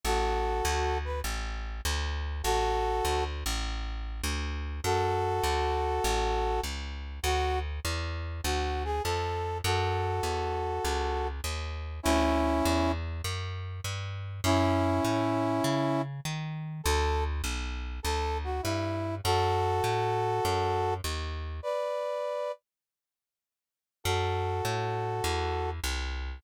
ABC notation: X:1
M:4/4
L:1/8
Q:"Swing" 1/4=100
K:A
V:1 name="Brass Section"
[FA]3 B z4 | [FA]3 z5 | [K:F#m] [FA]6 z2 | F z3 F G A2 |
[FA]6 z2 | [CE]3 z5 | [CE]6 z2 | A z3 A F E2 |
[FA]6 z2 | [Bd]3 z5 | [FA]6 z2 |]
V:2 name="Electric Bass (finger)" clef=bass
A,,,2 D,,2 A,,,2 D,,2 | A,,,2 D,, A,,,3 D,,2 | [K:F#m] F,,2 D,,2 A,,,2 C,,2 | D,,2 E,,2 D,,2 ^E,,2 |
F,,2 E,,2 C,,2 ^D,,2 | D,,2 E,,2 F,,2 =G,,2 | F,,2 A,,2 C,2 ^D,2 | D,,2 B,,,2 D,,2 =G,,2 |
F,,2 A,,2 F,,2 ^D,,2 | z8 | F,,2 A,,2 E,,2 =C,,2 |]